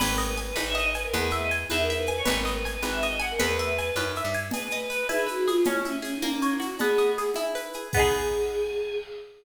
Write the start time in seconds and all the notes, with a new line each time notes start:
0.00 G#1 B4, crash, cowbell, low conga, shaker
0.10 A#4
0.18 D#5, shaker
0.28 B4
0.37 G#5, shaker
0.48 B4
0.56 G#1 B4, cowbell, high conga, shaker
0.66 E5
0.75 D#5, shaker
0.94 B4 G#5, shaker
1.04 A#4
1.13 E2 G#4 B4, cowbell, low conga, shaker
1.30 B4 E5, shaker
1.41 D#5
1.51 G#5, shaker
1.70 E2 B4 E5, cowbell, high conga, shaker
1.79 A#4
1.90 E5, shaker
1.97 B4
2.06 B4 G#5, shaker
2.17 C#5
2.25 G#1 B4, cowbell, low conga, shaker
2.36 A#4
2.45 D#5, shaker
2.54 B4
2.65 G#5, shaker
2.74 B4
2.82 G#1 B4, cowbell, high conga, shaker
2.92 E5
3.01 D#5, shaker
3.19 F#5 G#5, shaker
3.30 A#4
3.39 E2 B4, cowbell, low conga, shaker
3.58 E5, shaker
3.78 G#5, shaker
3.95 F#2 B4, cowbell, high conga, shaker
4.15 E5, shaker
4.25 G2
4.33 G#5, shaker
4.51 G#4 B4, cowbell, low conga, shaker
4.70 D#5, shaker
4.90 B4, shaker
5.09 E4 G#4, cowbell, high conga, shaker
5.26 F#4 B4, shaker
5.47 F4 G#4, shaker
5.64 C#4 E4, cowbell, low conga, shaker
5.75 E4
5.85 C#4 E5, shaker
5.95 C#4
6.02 C#4 G#4, shaker
6.13 D#4
6.22 A#3 C#4, cowbell, high conga, shaker
6.34 C#4
6.42 C#4 C#5, shaker
6.52 E4
6.60 F#4, shaker
6.79 B3 G#4, cowbell, low conga, shaker
6.98 D#5, shaker
7.18 G#4, shaker
7.34 E4, cowbell, high conga, shaker
7.55 B4, shaker
7.73 G#4, shaker
7.93 B3 G#4, kick, crash
7.97 D#4 G#4